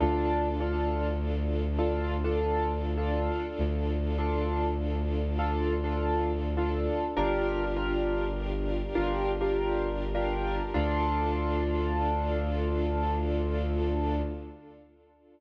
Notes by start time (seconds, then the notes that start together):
0.00 D2 D4 F4 A4
0.60 D4 F4 A4
1.79 D4 F4 A4
2.24 D4 F4 A4
2.98 D4 F4 A4
3.58 D2
4.18 D4 F4 A4
5.39 D4 F4 A4
5.84 D4 F4 A4
6.57 D4 F4 A4
7.17 G1 D4 F4 G4 A#4
7.76 D4 F4 G4 A#4
8.95 G1 D4 F4 G4 A#4
9.41 D4 F4 G4 A#4
10.15 D4 F4 G4 A#4
10.74 D2 D4 F4 A4